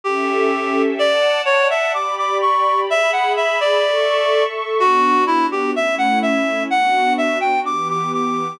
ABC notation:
X:1
M:2/2
L:1/8
Q:1/2=63
K:Bm
V:1 name="Clarinet"
G4 | d2 c e d' d' c'2 | e f e d4 z | F2 E G e f e2 |
f2 e g d' d' d'2 |]
V:2 name="Pad 2 (warm)"
[CGAe]4 | [dfa]4 [Gdb]4 | [^Geb]4 [Aec']4 | [B,DF]4 [A,CE]4 |
[B,DF]4 [E,B,G]4 |]